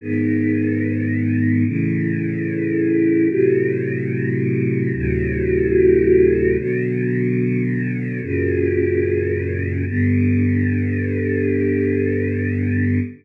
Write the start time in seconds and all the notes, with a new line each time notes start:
0.01 G#2 D#3 B3
1.65 A2 C#3 E3
3.29 A2 C3 F#3
4.93 D2 A2 C3 F#3
6.57 B2 D3 F#3
8.22 F#2 A#2 C#3
9.86 G2 D3 B3